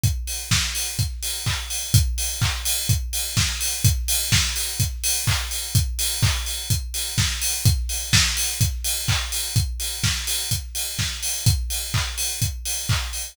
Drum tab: HH |xo-oxo-o|xo-oxo-o|xo-oxo-o|xo-oxo-o|
CP |------x-|--x-----|------x-|--x-----|
SD |--o-----|------o-|--o-----|------o-|
BD |o-o-o-o-|o-o-o-o-|o-o-o-o-|o-o-o-o-|

HH |xo-oxo-o|xo-oxo-o|xo-oxo-o|
CP |------x-|--------|--x---x-|
SD |--o-----|--o---o-|--------|
BD |o-o-o-o-|o-o-o-o-|o-o-o-o-|